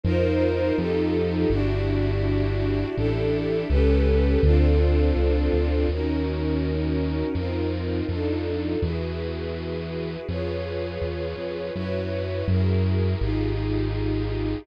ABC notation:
X:1
M:4/4
L:1/8
Q:1/4=82
K:Gmix
V:1 name="String Ensemble 1"
[_EF_Bc]2 [EFGA]2 [D=E^FG]4 | [DEGA]2 [^CGAB]2 [=CDFA]4 | [K:Abmix] [DEGB]4 [CEFB]2 [=DEF=A]2 | [_FGA_c]4 [=FAcd]4 |
[_FG_cd]2 [FGAB]2 [E=F=GA]4 |]
V:2 name="Synth Bass 1" clef=bass
F,,2 F,,2 G,,,4 | A,,,2 ^C,,2 D,,2 C,, D,, | [K:Abmix] E,,4 F,,2 F,,2 | _F,,4 =F,,2 =E,, F,, |
G,,2 G,,2 A,,,4 |]